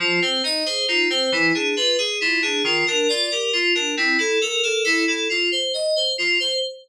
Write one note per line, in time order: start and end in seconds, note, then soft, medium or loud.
0.00 0.19 F3 loud
0.00 0.20 F4 medium
0.22 0.42 C4 medium
0.22 0.42 C5 medium
0.44 0.64 D#4 medium
0.44 0.65 D#5 medium
0.66 0.86 G#4 medium
0.66 0.86 C5 medium
0.88 1.08 D#4 medium
0.88 1.08 F4 medium
1.10 1.30 C4 medium
1.10 1.31 C5 medium
1.32 1.52 E3 medium
1.32 1.53 E4 medium
1.54 1.75 D4 medium
1.54 1.75 G#4 medium
1.76 1.97 F4 medium
1.76 1.97 B4 medium
1.98 2.19 G#4 medium
1.98 2.18 G#4 medium
2.21 2.41 E4 medium
2.21 2.41 F4 medium
2.42 2.62 D4 medium
2.42 2.63 G#4 medium
2.64 2.84 D#3 medium
2.64 2.85 F4 medium
2.87 3.08 D4 medium
2.87 3.07 A#4 medium
3.09 3.30 F4 medium
3.09 3.29 D5 medium
3.31 3.52 G4 medium
3.31 3.51 A#4 medium
3.53 3.73 F4 medium
3.75 3.95 D4 medium
3.75 3.95 A#4 medium
3.97 4.17 C4 medium
3.97 4.17 E4 medium
4.18 4.38 E4 medium
4.18 4.39 A4 medium
4.41 4.61 A4 medium
4.41 4.62 A#4 medium
4.63 4.83 A4 medium
4.63 4.83 A#4 medium
4.84 5.05 E4 medium
4.84 5.04 A4 medium
5.07 5.28 E4 medium
5.07 5.28 A4 medium
5.29 5.50 F4 medium
5.52 5.72 C5 medium
5.74 5.94 D#5 medium
5.96 6.16 C5 medium
6.18 6.38 F4 medium
6.40 6.60 C5 medium